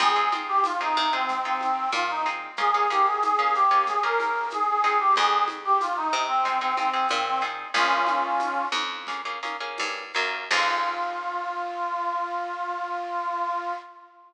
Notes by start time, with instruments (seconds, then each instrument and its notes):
0.00 electric bass (finger) F2, acoustic guitar (steel) C4 D#4 F4 G#4, clarinet G#4, low conga, shaker
0.16 acoustic guitar (steel) C4 D#4 F4 G#4
0.32 acoustic guitar (steel) C4 D#4 F4 G#4, high conga, shaker
0.48 clarinet G4
0.64 clarinet F4, tambourine, high conga, shaker
0.81 acoustic guitar (steel) C4 D#4 F4 G#4, clarinet D#4
0.96 electric bass (finger) C3, high conga, shaker
1.13 clarinet C4, acoustic guitar (steel) C4 D#4 F4 G#4
1.28 low conga, shaker
1.45 acoustic guitar (steel) C4 D#4 F4 G#4, clarinet C4
1.61 clarinet C4, high conga, shaker
1.92 electric bass (finger) A#2, clarinet F4, tambourine, high conga, shaker
2.10 clarinet D#4
2.26 acoustic guitar (steel) C4 D#4 F4 G#4, shaker
2.57 acoustic guitar (steel) A#3 C#4 F4 G#4, clarinet G#4, low conga, shaker
2.74 acoustic guitar (steel) A#3 C#4 F4 G#4
2.90 acoustic guitar (steel) A#3 C#4 F4 G#4, clarinet G4, high conga, shaker
3.06 clarinet G#4
3.22 clarinet G#4, tambourine, high conga, shaker
3.39 acoustic guitar (steel) A#3 C#4 F4 G#4
3.54 clarinet G4, shaker
3.71 acoustic guitar (steel) A#3 C#4 F4 G#4
3.86 clarinet G#4, low conga, shaker
4.02 acoustic guitar (steel) A#3 C#4 F4 G#4, clarinet A#4
4.20 high conga, shaker
4.50 clarinet G#4, tambourine, high conga, shaker
4.69 clarinet G#4
4.84 acoustic guitar (steel) C4 D#4 F4 G#4, shaker
5.00 clarinet G4
5.16 electric bass (finger) F2, clarinet G#4, low conga, shaker
5.48 high conga, shaker
5.65 clarinet G4
5.81 clarinet F4, tambourine, high conga, shaker
5.96 clarinet D#4
6.13 electric bass (finger) C3, shaker
6.28 clarinet C4
6.45 acoustic guitar (steel) C4 D#4 F4 G#4, low conga, shaker
6.61 clarinet C4, acoustic guitar (steel) C4 D#4 F4 G#4
6.76 clarinet C4, acoustic guitar (steel) C4 D#4 F4 G#4, high conga, shaker
6.94 acoustic guitar (steel) C4 D#4 F4 G#4
7.09 electric bass (finger) A#2, clarinet C4, tambourine, high conga, shaker
7.26 clarinet C4
7.41 acoustic guitar (steel) C4 D#4 F4 G#4, shaker
7.74 electric bass (finger) A#1, acoustic guitar (steel) A#3 C#4 F4 G#4, clarinet C#4 F4, low conga, shaker
8.07 high conga, shaker
8.39 tambourine, high conga, shaker
8.72 electric bass (finger) F2, high conga, shaker
9.07 acoustic guitar (steel) A#3 C#4 F4 G#4, low conga, shaker
9.25 acoustic guitar (steel) A#3 C#4 F4 G#4
9.43 acoustic guitar (steel) A#3 C#4 F4 G#4, high conga, shaker
9.60 acoustic guitar (steel) A#3 C#4 F4 G#4
9.78 electric bass (finger) G2, tambourine, high conga, shaker
10.13 electric bass (finger) F#2, acoustic guitar (steel) A#3 C#4 F4 G#4, shaker
10.51 electric bass (finger) F2, acoustic guitar (steel) C4 D#4 F4 G#4, clarinet F4, kick, crash